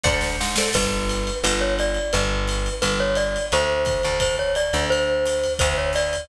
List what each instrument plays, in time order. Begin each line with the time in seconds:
0.04 electric bass (finger) D2, acoustic guitar (steel) A4 C5 D5 F#5, kick, snare
0.21 snare
0.41 electric bass (finger) G#2, snare
0.56 acoustic guitar (steel) A4 C5 D5 F#5, snare
0.73 electric bass (finger) G1, glockenspiel B4, kick, crash, ride
1.09 hi-hat pedal, ride
1.27 ride
1.44 electric bass (finger) G1, glockenspiel B4, ride
1.61 glockenspiel C#5
1.79 glockenspiel D5, hi-hat pedal, ride
1.95 ride
2.13 electric bass (finger) G1, glockenspiel B4, ride
2.48 hi-hat pedal, ride
2.66 ride
2.82 electric bass (finger) G1, glockenspiel B4, ride
3.00 glockenspiel C#5
3.15 glockenspiel D5, hi-hat pedal, ride
3.36 ride
3.52 electric bass (finger) D2, glockenspiel C5, ride
3.85 kick, hi-hat pedal, ride
4.03 electric bass (finger) D2, ride
4.20 glockenspiel C5, kick, ride
4.39 glockenspiel C#5
4.55 glockenspiel D5, hi-hat pedal, ride
4.73 electric bass (finger) D2, ride
4.90 glockenspiel C5, ride
5.26 hi-hat pedal, ride
5.44 ride
5.59 electric bass (finger) D2, glockenspiel C5, kick, ride
5.78 glockenspiel C#5
5.93 glockenspiel D5, hi-hat pedal, ride
6.13 ride